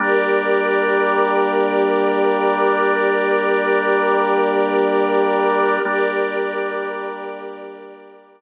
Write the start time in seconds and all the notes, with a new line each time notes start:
0.00 G3 A#3 D4 G4 A#4 D5
5.85 G3 A#3 D4 G4 A#4 D5